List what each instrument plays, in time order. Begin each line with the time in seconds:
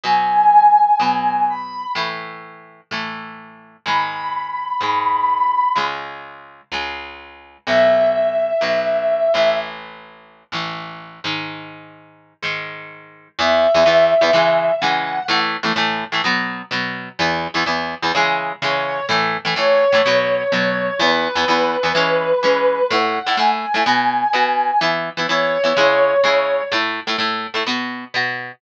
0.03 overdriven guitar B2 F#3 B3, brass section G#5
1.00 overdriven guitar B2 F#3 B3
1.50 brass section B5
1.95 overdriven guitar A2 E3 A3
2.91 overdriven guitar A2 E3 A3
3.86 overdriven guitar G#2 D#3 G#3, brass section B5
4.81 overdriven guitar G#2 D#3 G#3
5.75 overdriven guitar C#2 C#3 G#3
6.72 overdriven guitar C#2 C#3 G#3
7.67 overdriven guitar B1 B2 F#3, brass section E5
8.61 overdriven guitar B1 B2 F#3
9.34 overdriven guitar A1 A2 E3
10.52 overdriven guitar A1 A2 E3
11.24 overdriven guitar G#2 D#3 G#3
12.42 overdriven guitar G#2 D#3 G#3
13.39 overdriven guitar E2 E3 B3, brass section E5
13.74 overdriven guitar E2 E3 B3
13.86 overdriven guitar E2 E3 B3
14.21 overdriven guitar E2 E3 B3
14.33 overdriven guitar C#3 E3 G#3
14.80 overdriven guitar C#3 E3 G#3, brass section F#5
15.28 overdriven guitar A2 E3 A3
15.63 overdriven guitar A2 E3 A3
15.76 overdriven guitar A2 E3 A3
16.12 overdriven guitar A2 E3 A3
16.24 overdriven guitar B2 F#3 B3
16.71 overdriven guitar B2 F#3 B3
17.19 overdriven guitar E2 E3 B3
17.54 overdriven guitar E2 E3 B3
17.66 overdriven guitar E2 E3 B3
18.02 overdriven guitar E2 E3 B3
18.15 overdriven guitar C#3 E3 G#3
18.62 overdriven guitar C#3 E3 G#3, brass section C#5
19.09 overdriven guitar A2 E3 A3
19.45 overdriven guitar A2 E3 A3
19.56 overdriven guitar A2 E3 A3, brass section C#5
19.92 overdriven guitar A2 E3 A3
20.06 overdriven guitar B2 F#3 B3
20.52 overdriven guitar B2 F#3 B3
20.99 overdriven guitar E2 E3 B3, brass section B4
21.35 overdriven guitar E2 E3 B3
21.48 overdriven guitar E2 E3 B3
21.83 overdriven guitar E2 E3 B3
21.95 overdriven guitar E3 G#3 C#4
22.43 overdriven guitar E3 G#3 C#4
22.90 overdriven guitar A2 A3 E4, brass section F#5
23.26 overdriven guitar A2 A3 E4
23.37 overdriven guitar A2 A3 E4, brass section G#5
23.74 overdriven guitar A2 A3 E4
23.86 overdriven guitar B2 B3 F#4
24.33 overdriven guitar B2 B3 F#4
24.81 overdriven guitar E3 B3 E4
25.17 overdriven guitar E3 B3 E4
25.27 overdriven guitar E3 B3 E4, brass section C#5
25.64 overdriven guitar E3 B3 E4
25.76 overdriven guitar C#3 G#3 E4
26.24 overdriven guitar C#3 G#3 E4
26.72 overdriven guitar A2 A3 E4
27.07 overdriven guitar A2 A3 E4
27.18 overdriven guitar A2 A3 E4
27.54 overdriven guitar A2 A3 E4
27.66 overdriven guitar B2 B3 F#4
28.14 overdriven guitar B2 B3 F#4